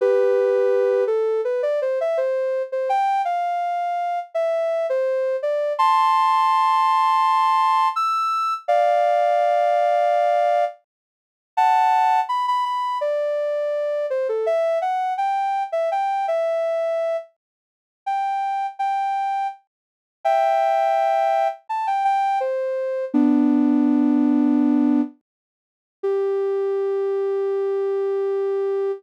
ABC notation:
X:1
M:4/4
L:1/16
Q:1/4=83
K:Gmix
V:1 name="Ocarina"
[GB]6 A2 B d c e c3 c | g2 f6 e3 c3 d2 | [ac']12 e'4 | [df]12 z4 |
[K:Dmix] [fa]4 b b b2 d6 c A | e2 f2 g3 e g2 e6 | z4 g4 g4 z4 | [K:Gmix] [eg]8 a g g2 c4 |
[B,D]12 z4 | G16 |]